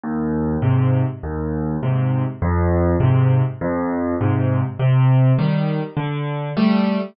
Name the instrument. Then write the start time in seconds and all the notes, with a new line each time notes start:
acoustic grand piano
0.03 D#2
0.62 G#2 C3
1.23 D#2
1.83 G#2 C3
2.42 F2
3.00 G#2 C3
3.61 F2
4.21 G#2 C3
4.79 C3
5.39 D#3 G3
5.97 D3
6.57 G3 A3